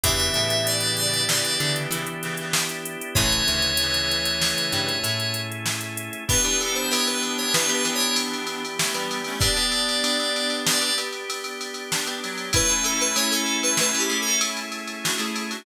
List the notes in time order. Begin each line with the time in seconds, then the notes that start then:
0.04 E2 C#3 E3 B3 D4 E4 G4 E5, kick, closed hi-hat
0.20 closed hi-hat
0.34 A2 A3, closed hi-hat
0.50 closed hi-hat
0.67 D5, closed hi-hat
0.80 closed hi-hat
0.97 D5, closed hi-hat
1.14 closed hi-hat
1.29 C#3 E3 D5, snare
1.45 closed hi-hat
1.60 C#3 D3 E3 D4, closed hi-hat
1.76 closed hi-hat
1.91 C#3 E3 E4, closed hi-hat
2.07 closed hi-hat
2.23 C#3 E3, closed hi-hat
2.37 C#3 E3, closed hi-hat
2.53 snare
2.69 closed hi-hat
2.86 closed hi-hat
3.01 closed hi-hat
3.15 A1 C#3 E3 A3 C#4 E4 G#4 C#5, kick, closed hi-hat
3.32 closed hi-hat
3.47 D2 D3, closed hi-hat
3.62 closed hi-hat
3.77 C#3 E3, closed hi-hat
3.94 closed hi-hat
4.11 closed hi-hat
4.25 closed hi-hat
4.42 snare
4.58 closed hi-hat
4.72 G2 G3, closed hi-hat
4.89 closed hi-hat
5.04 A2 A3, closed hi-hat
5.20 closed hi-hat
5.34 closed hi-hat
5.52 closed hi-hat
5.66 snare
5.81 closed hi-hat
5.97 closed hi-hat
6.13 closed hi-hat
6.28 E3 B3 D4 G4 B4, kick, crash
6.44 E3 B3 D4 G4, ride
6.59 A4, ride
6.74 C5, ride
6.90 E3 B3 D4 G4 C#5, ride
7.07 B4, ride
7.23 ride
7.38 C#5, ride
7.54 E3 B3 D4 G4 B4, snare
7.68 E3 B3 D4 G4, ride
7.74 B4
7.85 E3 B3 D4 G4, ride
7.95 C#5
8.00 ride
8.16 ride
8.33 ride
8.47 ride
8.65 ride
8.79 A3 C#4, snare
8.94 E3 G3 B3 D4 G4, ride
9.11 ride
9.24 A3 C#4, ride
9.39 B3 D4 G4 D5, kick, ride
9.56 B3 D4 G4, ride
9.72 ride
9.89 ride
10.04 B3 D4 G4, ride
10.20 ride
10.36 ride
10.50 ride
10.67 B3 D4 G4 D5, snare
10.81 B3 D4 G4, ride
10.98 B3 D4 G4, ride
11.12 ride
11.30 ride
11.44 ride
11.61 ride
11.74 ride
11.91 D4, snare
12.06 B3 D4 G4, ride
12.23 F#3, ride
12.38 ride
12.53 A3 C#4 E4 G#4 B4, kick, ride
12.69 A3 C#4 E4 G#4, ride
12.84 A4, ride
13.00 B4, ride
13.16 A3 C#4 E4 G#4 C#5, ride
13.31 A4, ride
13.46 ride
13.63 B4, ride
13.77 A3 C#4 E4 G#4 B4, snare
13.95 A3 C#4 E4 G#4, ride
13.99 G4
14.10 A3 C#4 E4 G#4, ride
14.22 A4
14.27 ride
14.41 ride
14.57 ride
14.72 ride
14.88 ride
15.04 D4 F#4, snare
15.18 A3 C#4 E4 G#4, ride
15.36 ride
15.51 D4 F#4, ride